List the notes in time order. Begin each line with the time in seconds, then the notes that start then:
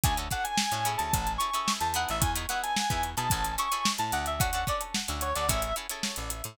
0.04 D2 C#4 D4 F#4 A4 G#5, kick, closed hi-hat
0.17 C#4 D4 F#4 A4, closed hi-hat
0.31 C#4 D4 F#4 A4 F#5, kick, closed hi-hat
0.44 G#5, closed hi-hat
0.58 snare
0.72 A2 C#4 D4 F#4 A4, closed hi-hat
0.85 C#4 E4 G#4 A4, snare, closed hi-hat
0.98 D2 A5, closed hi-hat
1.13 A1, kick, closed hi-hat
1.27 closed hi-hat
1.38 C#4 E4 G#4 A4 C#6, closed hi-hat
1.54 C#4 E4 G#4 A4, closed hi-hat
1.68 snare
1.80 E2 A5, snare, closed hi-hat
1.94 B3 D#4 E4 G#4 F#5, closed hi-hat
2.09 A1 E5, closed hi-hat
2.21 E2 G#5, kick, closed hi-hat
2.35 B3 D#4 E4 G#4, closed hi-hat
2.49 B3 D#4 E4 G#4 F#5, snare, closed hi-hat
2.63 G#5, closed hi-hat
2.76 snare
2.90 E2 B3 D#4 E4 G#4, kick, closed hi-hat
3.03 closed hi-hat
3.17 B2 B3 D#4 E4 G#4 A5, closed hi-hat
3.30 A1 C#4 E4 G#4 A4, kick, closed hi-hat
3.45 closed hi-hat
3.58 C#4 E4 G#4 A4 C#6, closed hi-hat
3.72 C#4 E4 G#4 A4, closed hi-hat
3.85 snare
3.98 A2 A5, closed hi-hat
4.12 D2 F#5, closed hi-hat
4.26 E5, closed hi-hat
4.40 C#4 D4 F#4 A4 F#5, kick, closed hi-hat
4.53 C#4 D4 F#4 A4, closed hi-hat
4.67 C#4 D4 F#4 A4 D5, kick, snare, closed hi-hat
4.81 closed hi-hat
4.95 snare
5.08 D2 C#4 D4 F#4 A4, closed hi-hat
5.21 C#5, closed hi-hat
5.35 D2 C#4 D4 F#4 A4 D5, closed hi-hat
5.49 A1 C#4 E4 G#4 A4 E5, kick, closed hi-hat
5.62 closed hi-hat
5.76 C#4 E4 G#4 A4, closed hi-hat
5.89 C#4 E4 G#4 A4, closed hi-hat
6.03 snare
6.16 A1, closed hi-hat
6.30 closed hi-hat
6.44 A2, closed hi-hat